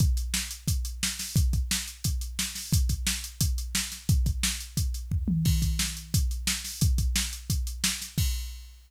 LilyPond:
\new DrumStaff \drummode { \time 4/4 \tempo 4 = 176 <hh bd>8 hh8 sn8 hh8 <hh bd>8 hh8 sn8 <hho sn>8 | <hh bd>8 <hh bd>8 sn8 hh8 <hh bd>8 hh8 sn8 <hho sn>8 | <hh bd>8 <hh bd>8 sn8 hh8 <hh bd>8 hh8 sn8 <hh sn>8 | <hh bd>8 <hh bd>8 sn8 hh8 <hh bd>8 hh8 <bd tomfh>8 tommh8 |
<cymc bd>8 <hh bd>8 sn8 hh8 <hh bd>8 hh8 sn8 <hho sn>8 | <hh bd>8 <hh bd>8 sn8 hh8 <hh bd>8 hh8 sn8 <hh sn>8 | <cymc bd>4 r4 r4 r4 | }